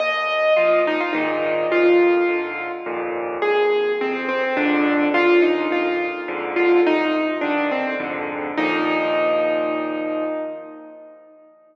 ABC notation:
X:1
M:3/4
L:1/16
Q:1/4=105
K:Eb
V:1 name="Acoustic Grand Piano"
e4 F2 E F E4 | F8 z4 | A4 C2 C C D4 | F2 E2 F4 z2 F2 |
E3 z D2 C2 z4 | E12 |]
V:2 name="Acoustic Grand Piano" clef=bass
E,,4 [B,,F,]4 [A,,B,,E,]4 | F,,4 [A,,D,]4 [E,,F,,B,,]4 | A,,,4 [F,,C,]4 [B,,,F,,A,,D,]4 | E,,4 [F,,B,,]4 [F,,A,,D,]4 |
C,,4 [G,,D,E,]4 [F,,A,,D,]4 | [E,,B,,F,]12 |]